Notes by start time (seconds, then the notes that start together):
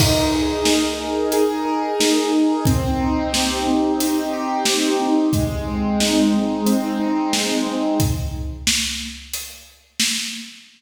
0.00 D#4, kick, crash
0.35 G#4
0.65 A#4, snare
1.00 D#4
1.32 G#4, closed hi-hat
1.65 A#4
2.00 D#4, snare
2.33 G#4
2.65 C4, kick, closed hi-hat
3.00 D#4
3.32 G4, snare
3.67 C4
4.00 D#4, closed hi-hat
4.33 G4
4.65 C4, snare
5.01 D#4
5.33 G#3, kick, closed hi-hat
5.67 C4
6.00 D#4, snare
6.34 G#3
6.66 C4, closed hi-hat
7.00 D#4
7.33 G#3, snare
7.67 C4
8.00 kick, closed hi-hat
8.67 snare
9.33 closed hi-hat
10.00 snare